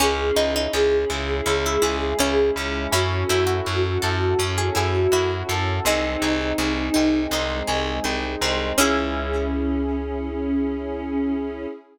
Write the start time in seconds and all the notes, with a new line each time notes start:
0.00 C#2 C#4 E4 G#4
0.36 C#2 D#4 E4 G#4
0.56 D#4
0.73 C#2 C#4 G#4
1.10 C#2 C#4 E4
1.46 C#2 G#3 C#4 E4 G#4
1.66 E4
1.82 C#2 E4 G#4
2.19 C#2 C#4 E4
2.55 C#2 C#4 E4
2.91 F#2 C#4 E4 F#4 A4
3.29 F#2 E4 F#4
3.47 F#4
3.65 F#2 F#4
4.02 F#2 A4
4.39 F#2 C#4 E4 A4 C#5
4.58 G#4
4.75 F#2 E4 G#4
5.12 F#2 E4 F#4
5.49 F#2 A4
5.85 C2 G#3 C4 D#4 G#4
6.22 C2 D#4 G#4
6.58 C2 C4 G#4
6.94 C2 C4 D#4
7.31 C2 G#3 C4 D#4 G#4
7.67 C2 G#4
8.04 C2 C4 D#4
8.41 C2 C4 D#4
8.78 C#2 C#4 E4 G#4